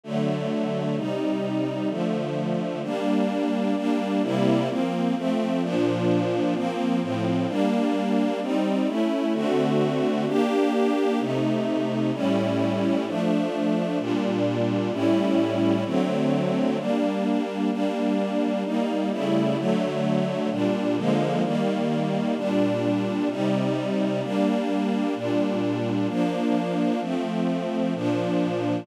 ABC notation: X:1
M:4/4
L:1/8
Q:1/4=129
K:Gm
V:1 name="String Ensemble 1"
[D,^F,A,]4 | [C,G,E]4 [D,F,A,]4 | [G,B,D]4 [G,B,D]2 [C,G,B,=E]2 | [F,B,C]2 [F,A,C]2 [B,,F,D]4 |
[F,B,C]2 [A,,F,C]2 [G,B,D]4 | [G,CE]2 [A,^C=E]2 [D,A,=C^F]4 | [B,DG]4 [C,A,E]4 | [A,,G,^C=E]4 [F,A,D]4 |
[B,,G,D]4 [A,,G,^C=E]4 | [D,^F,A,C]4 [G,B,D]4 | [G,B,D]4 [G,B,E]2 [^C,G,A,=E]2 | [D,^F,A,]4 [B,,G,D]2 [D,=F,_A,B,]2 |
[E,G,B,]4 [B,,G,D]4 | [C,G,E]4 [G,B,D]4 | [B,,G,D]4 [F,B,D]4 | [F,A,C]4 [B,,F,D]4 |]